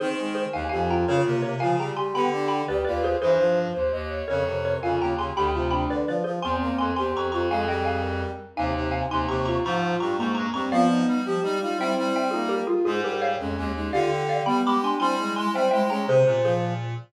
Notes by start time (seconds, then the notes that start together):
0.00 D#3 C4 D#4 G#4 C5
0.18 G#3
0.35 G#4 C5
0.53 D#2 D#3 D#4 F5 G#5
0.69 F2 F3 G4 F5 G#5
0.89 F4 G5 A#5
1.07 C#3 C#4 F4 A#4 C#5
1.25 C3 A#3
1.42 C3 A#4 C#5
1.60 C#3 F3 F4 F5 G#5
1.79 G3 G#4 G5 A#5
1.96 G4 G#5 C6
2.14 D3 B3 G4 G5 B5
2.32 D4
2.48 G5 B5
2.68 D2 G4 B4 D5
2.84 D#2 F4 B4 D5
3.03 G#4 C5
3.21 G2 E3 G#4 C5
3.39 F3
3.74 D#2 C5
3.92 D#2 D#5
4.10 C#5
4.28 F2 C#3 A#4 C#5
4.46 C3
4.65 A#4 C#5
4.82 F2 C#3 F4 F5 G#5
5.00 D#2 C#3 G5 A#5
5.18 C#3 G#4 G#5 C6
5.36 D2 D3 G4 G5 B5
5.53 C3 F4
5.71 D4 G5 B5
5.90 D3 B4 D5
6.07 F3 B4 D5
6.24 F3 G#4 C5
6.42 E2 C4 G#5 C6
6.61 A#3
6.78 F2 G#5 C6
6.96 E2 C4 G4 G#5 C6
7.14 F2 C4 A#5 C#6
7.32 F2 C4 F4 A#5 C#6
7.50 F2 G#3 G#4 F5 G#5
7.68 G3 D#5 G5
7.85 F5 G#5
8.02 A#4
8.56 D#2 C3 D#4 F5 G#5
8.75 C3
8.91 F5 G#5
9.10 D#2 C3 D#4 G#5 C6
9.28 D#2 C3 G4 A#5 C#6
9.45 F4 A#5 C#6
9.64 G#2 F3 F4 A#5 C#6
10.00 G2 G3 A#5 C#6
10.18 G#2 G#3 A#3 A#5 C#6
10.35 G2 A#5 C#6
10.54 G2 G3 C4 A#5 C#6
10.71 F3 B3 F4 D5 F5
10.89 D#4
11.07 G3
11.25 F3 G4
11.42 G3 D#4
11.60 G3 D#4 F4
11.78 G3 C4 E4 E5 G5
11.97 G3
12.16 E5 G5
12.31 A#3 D#4 F4 G#4
12.49 G4 A#4
12.67 F4 G#4
12.85 G#2 G#3 F4 G#4
13.03 G3 G4 A#4
13.22 C#5 F5
13.39 F2 G#3 C#4
13.57 D#2 G#3
13.75 G#3 D#4
13.92 D3 F4 G4 D5 F5
14.11 G4
14.29 D5 F5
14.46 G3 B3 G4 G5 B5
14.64 G#3 G4 B5 D6
14.82 D4 G#5 C6
14.99 G3 C4 E4 G#5 C6
15.18 G#3
15.36 G#3 G#5 C6
15.54 G3 C4 C5 E5 G5
15.71 G#3 E4 E5 G5
15.89 G#3 C#4 G#4 G5 A#5
16.07 C3 G#4 C5
16.25 A#2 C3
16.43 F3 G#4 C5